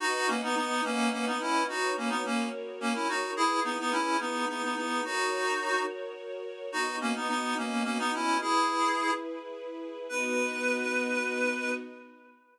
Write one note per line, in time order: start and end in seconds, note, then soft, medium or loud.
0.00 0.27 D#4 loud
0.00 0.27 F#4 loud
0.00 1.66 B4 medium
0.00 1.66 D#5 medium
0.00 1.66 F#5 medium
0.28 0.41 A#3 medium
0.28 0.41 C#4 medium
0.43 0.55 B3 medium
0.43 0.55 D#4 medium
0.56 0.81 B3 medium
0.56 0.81 D#4 medium
0.84 1.09 A#3 medium
0.84 1.09 C#4 medium
1.12 1.25 A#3 medium
1.12 1.25 C#4 medium
1.26 1.40 B3 medium
1.26 1.40 D#4 medium
1.41 1.64 C#4 medium
1.41 1.64 E4 medium
1.68 1.93 D#4 medium
1.68 1.93 F#4 medium
1.68 2.24 F#4 medium
1.68 2.24 B4 medium
1.68 2.24 C#5 medium
1.96 2.10 A#3 medium
1.96 2.10 C#4 medium
2.10 2.23 B3 medium
2.10 2.23 D#4 medium
2.25 2.49 A#3 medium
2.25 2.49 C#4 medium
2.25 3.36 F#4 medium
2.25 3.36 A#4 medium
2.25 3.36 C#5 medium
2.80 2.94 A#3 medium
2.80 2.94 C#4 medium
2.95 3.08 C#4 medium
2.95 3.08 E4 medium
3.09 3.31 D#4 medium
3.09 3.31 F#4 medium
3.36 3.60 E4 medium
3.36 5.03 E4 medium
3.36 3.60 G#4 loud
3.36 5.03 G#4 medium
3.36 5.03 B4 medium
3.64 3.78 B3 medium
3.64 3.78 D#4 medium
3.79 3.92 B3 medium
3.79 3.92 D#4 medium
3.92 4.17 C#4 medium
3.92 4.17 E4 medium
4.20 4.45 B3 medium
4.20 4.45 D#4 medium
4.49 4.62 B3 medium
4.49 4.62 D#4 medium
4.63 4.76 B3 medium
4.63 4.76 D#4 medium
4.76 5.02 B3 medium
4.76 5.02 D#4 medium
5.04 5.84 D#4 medium
5.04 6.71 F#4 medium
5.04 5.84 F#4 loud
5.04 6.71 A#4 medium
5.04 6.71 C#5 medium
6.72 8.39 B3 medium
6.72 6.96 D#4 medium
6.72 6.96 F#4 medium
6.72 8.39 F#4 medium
6.72 8.39 D#5 medium
7.01 7.14 A#3 medium
7.01 7.14 C#4 medium
7.15 7.28 B3 medium
7.15 7.28 D#4 medium
7.29 7.54 B3 medium
7.29 7.54 D#4 medium
7.57 7.83 A#3 medium
7.57 7.83 C#4 medium
7.85 7.98 A#3 medium
7.85 7.98 C#4 medium
7.98 8.12 B3 medium
7.98 8.12 D#4 medium
8.14 8.38 C#4 medium
8.14 8.38 E4 medium
8.41 10.07 E4 medium
8.41 9.11 E4 medium
8.41 10.07 G#4 medium
8.41 9.11 G#4 loud
8.41 10.07 B4 medium
10.09 11.72 B3 loud
10.09 11.72 D#4 loud
10.09 11.72 F#4 loud
10.09 11.71 B4 loud